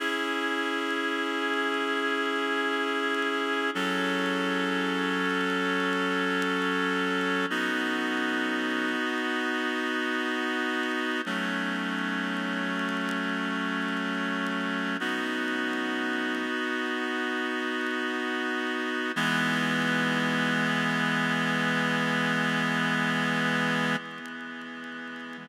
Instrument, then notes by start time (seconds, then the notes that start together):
clarinet
0.00 C#4 E4 G#4
3.75 F#3 C#4 A4
7.50 B3 D#4 F#4
11.26 F#3 A3 C#4
15.00 B3 D#4 F#4
19.16 E3 G#3 B3